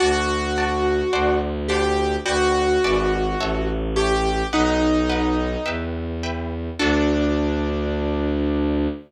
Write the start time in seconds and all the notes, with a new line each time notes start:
0.00 D2 F#4 D5 F#5 A5
0.58 D5 F#5 A5
1.13 D2 C5 D5 F#5 A5
1.68 G4 C5 D5 F#5 A5
2.26 D2 F#4 B4 D5 G5
2.83 G#1 B4 D5 E5 G#5
3.39 A1 C#5 E5 A5
3.96 G4 C#5 E5 A5
4.52 B1 D#4 B4 D#5 F#5
5.10 B4 D#5 F#5
5.66 E2 B4 E5 G5
6.23 B4 E5 G5
6.79 D2 D4 F#4 A4